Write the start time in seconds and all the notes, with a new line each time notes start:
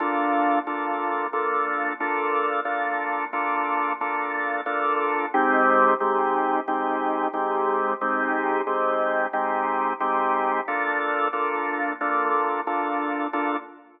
0.00 A#3 D4 F4 A4
0.67 A#3 D4 F4 A4
1.33 A#3 D4 F4 A4
2.00 A#3 D4 F4 A4
2.65 A#3 D4 F4 A4
3.33 A#3 D4 F4 A4
4.01 A#3 D4 F4 A4
4.66 A#3 D4 F4 A4
5.34 G#3 C4 D#4 G4
6.00 G#3 C4 D#4 G4
6.68 G#3 C4 D#4 G4
7.33 G#3 C4 D#4 G4
8.01 G#3 C4 D#4 G4
8.67 G#3 C4 D#4 G4
9.33 G#3 C4 D#4 G4
10.00 G#3 C4 D#4 G4
10.68 A#3 D4 F4 A4
11.33 A#3 D4 F4 A4
12.01 A#3 D4 F4 A4
12.67 A#3 D4 F4 A4
13.33 A#3 D4 F4 A4